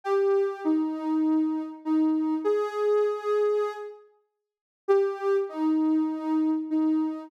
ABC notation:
X:1
M:4/4
L:1/8
Q:1/4=99
K:Cm
V:1 name="Ocarina"
G2 E4 E2 | A5 z3 | G2 E4 E2 |]